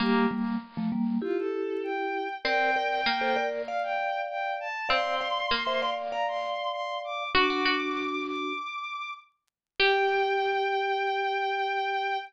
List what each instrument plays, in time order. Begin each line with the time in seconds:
0.00 vibraphone G3 A#3, pizzicato strings A#3, violin G4
0.31 vibraphone G3 A#3
0.77 vibraphone F3 A3
0.92 vibraphone G3 A#3
1.22 vibraphone E4 G4, violin F4
1.38 violin A4
1.83 violin G5
2.45 pizzicato strings C4, vibraphone A#4 D5, violin G5
2.76 vibraphone A#4 D5
3.06 pizzicato strings A#3
3.21 vibraphone A4 C5
3.36 vibraphone A#4 D5
3.67 vibraphone D5 F5, violin F5
3.83 violin G5
4.29 violin G5
4.60 violin A5
4.89 pizzicato strings C4, vibraphone D5 F5, violin C6
5.21 vibraphone D5 F5
5.51 pizzicato strings A#3
5.67 vibraphone C5 E5
5.82 vibraphone D5 F5
6.11 vibraphone D5 F5, violin A#5
6.28 violin C6
6.72 violin C6
7.04 violin D6
7.35 vibraphone D4 F#4, pizzicato strings F#4, violin D6
7.50 pizzicato strings F#4
7.65 pizzicato strings F#4
8.26 violin D6
9.79 pizzicato strings G4, vibraphone G4, violin G5